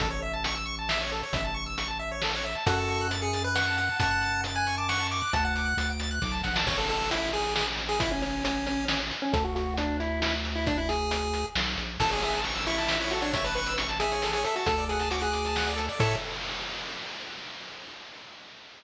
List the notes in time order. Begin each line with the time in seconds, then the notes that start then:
0.00 A1 A4, kick, closed hi-hat
0.10 C#5
0.22 E5
0.33 A5
0.44 C#6, closed hi-hat
0.55 E6
0.66 C#6
0.79 A5
0.89 E5, snare
1.01 C#5
1.12 A4
1.23 C#5
1.33 A1 E5, kick, closed hi-hat
1.44 A5
1.54 C#6
1.66 E6
1.78 C#6, closed hi-hat
1.88 A5
1.99 E5
2.11 C#5
2.22 A4, snare
2.35 C#5
2.44 E5
2.55 A5
2.66 F#2 F#4 A4 F#5, kick, closed hi-hat
2.78 A5
2.88 C#6, closed hi-hat
3.01 F#6
3.11 A6, closed hi-hat
3.21 G#4 C#7
3.33 A6, closed hi-hat
3.44 B4 F#6
3.55 F#5 C#6, snare
3.68 A5
3.76 F#5, closed hi-hat
3.89 A5
4.00 F#2 F#5 A5 C#6, kick, closed hi-hat
4.11 F#6
4.22 A6, closed hi-hat
4.34 C#7
4.44 A6, closed hi-hat
4.55 G#5 F#6
4.66 C#6, closed hi-hat
4.77 A5 D6
4.89 F#5 C#6, snare
5.00 A5
5.10 C#6 D6, closed hi-hat
5.22 F#6
5.33 D2 F#5 A5, kick, closed hi-hat
5.44 F#5 A5
5.55 D6, closed hi-hat
5.66 F#6
5.77 D2 A6, closed hi-hat
5.89 D7
6.00 A6, closed hi-hat
6.11 F#6
6.22 B1 D6, kick, snare
6.32 A5
6.43 A#1 F#5, snare
6.56 A5, snare
6.66 A1 C#5, kick, crash
6.78 A4
6.89 A4, closed hi-hat
7.11 E4, closed hi-hat
7.33 G#4, closed hi-hat
7.56 G#4, snare
7.78 closed hi-hat
7.89 G#4
8.00 E4, kick, closed hi-hat
8.11 C#4
8.22 C#4, closed hi-hat
8.45 C#4, closed hi-hat
8.66 C#4, closed hi-hat
8.88 C#4, snare
9.11 closed hi-hat
9.22 C#4
9.33 D2 A4, kick, closed hi-hat
9.44 F#4
9.56 F#4, closed hi-hat
9.77 D4, closed hi-hat
10.00 E4, closed hi-hat
10.22 E4, snare
10.45 closed hi-hat
10.56 E4
10.67 D4, kick, closed hi-hat
10.78 E4
10.89 G#4, closed hi-hat
11.11 closed hi-hat
11.34 closed hi-hat
11.55 B1, snare
11.77 A#1, closed hi-hat
12.00 A1 A4, kick, crash
12.11 G#4 C#5, closed hi-hat
12.22 G#4 E5, closed hi-hat
12.33 A5, closed hi-hat
12.44 C#6, closed hi-hat
12.55 E6, closed hi-hat
12.67 E4 C#6, closed hi-hat
12.78 A5, closed hi-hat
12.88 E5, snare
13.00 E4 C#5, closed hi-hat
13.11 F#4 A4, closed hi-hat
13.21 D4 C#5, closed hi-hat
13.33 C#5 E5, kick, closed hi-hat
13.44 B4 A5, closed hi-hat
13.55 B4 C#6, closed hi-hat
13.66 E6, closed hi-hat
13.78 C#6, closed hi-hat
13.88 A5, closed hi-hat
14.00 G#4 E5, closed hi-hat
14.12 C#5, closed hi-hat
14.22 A4, snare
14.33 G#4 C#5, closed hi-hat
14.44 A4 E5, closed hi-hat
14.56 F#4 A5, closed hi-hat
14.66 D2 A4, kick, closed hi-hat
14.78 D5, closed hi-hat
14.89 G#4 F#5, closed hi-hat
14.99 A5, closed hi-hat
15.10 F#4 D6, closed hi-hat
15.21 G#4 F#6, closed hi-hat
15.32 D6, closed hi-hat
15.45 A5, closed hi-hat
15.56 F#5, snare
15.67 D5, closed hi-hat
15.76 A4, closed hi-hat
15.89 D5, closed hi-hat
15.99 A2 A4 C#5 E5, kick, crash